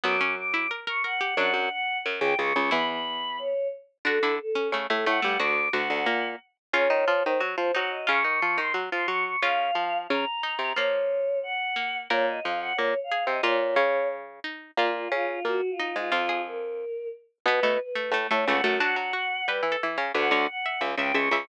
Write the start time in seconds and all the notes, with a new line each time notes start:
0.04 F#2 F#3 B3 D6
0.21 C#4
0.37 D6
0.54 E4
0.71 A#4
0.87 A#4 C#6
1.04 A#4 F#5
1.21 G4
1.37 F#2 F#3 D4 F#5
1.54 F#2 F#3
1.71 F#5
2.06 F#2 F#3
2.20 C#2 C#3 G5
2.39 C#2 C#3 C#6
2.56 C#2 C#3
2.71 E2 E3 E4 B5
2.89 B5
3.39 C#5
4.05 D3 D4 F#4 A4
4.23 D3 D4 E4
4.40 A4
4.55 C#4
4.72 C#3 A3 C#4
4.90 A2 A3 A4
5.06 A2 A3 F#5
5.22 G2 G3 A3
5.39 D2 D3 F#4 D6
5.73 D2 D3 F#4 F#5
5.90 D2 D3
6.06 A#2 A#3
6.73 C#3 C#4 F4 C#5
6.90 D#3 D#4
7.08 F3 F4
7.23 D#3 D#4 C5
7.40 F#3 F#4
7.57 F3 F4 C5
7.74 F#3 D#4 F#4 F#5
7.91 D#5
8.07 C#3 C#4 F4 C#6
8.24 D#3 D#4
8.42 F3 F4
8.58 D#3 D#4 C6
8.74 F#3 F#4
8.91 F3 F4 C6
9.08 F#3 F#4 C#6
9.25 C#6
9.42 C#3 C#4 F4 F5
9.75 F3 F4
10.09 C#3 C#4 A#5
10.43 D#4
10.59 C3 C4
10.76 F3 A#3 F4 C#5
11.43 F#5
11.76 A#3
12.10 A#2 A#3 A#4 C#5
12.28 D#5
12.43 F2 F3 F5
12.60 F#5
12.76 A#2 A#3 C#5
13.04 F5
13.12 G#4
13.27 C3 C4 D#5
13.43 A#2 A#3 F4 C#5
13.76 C#3 C#4
14.44 D#4
14.77 A#2 A#3 F4
14.94 F4
15.12 C#3 C#4 F4
15.29 F4
15.45 A#2 A#3 F#4
15.71 F4
15.79 D#4
15.95 G#2 G#3 F4
16.12 F2 F3 F4
16.29 G#4
16.47 A#4
17.46 B2 B3 B4
17.63 B2 A3 B3
17.80 B4
17.95 A3
18.12 A2 A3
18.30 A2 A3 C#5
18.46 C#2 C#3 A3 F#5
18.64 F#2 F#3 A3
18.80 F#3 D4 F#4 F#5
18.96 F#3 F#4
19.13 F#4
19.47 G3 G4 B4
19.63 E3 E4
19.72 A4
19.83 E3 E4
19.98 C#3 C#4 C#5
20.14 D2 D3 B4 F#5
20.31 D2 D3 C#5
20.48 F#5
20.66 E5
20.81 C#2 C#3 E5
20.97 C#2 C#3 E5 G5
21.14 C#2 C#3 E5 C#6
21.31 C#2 C#3 E5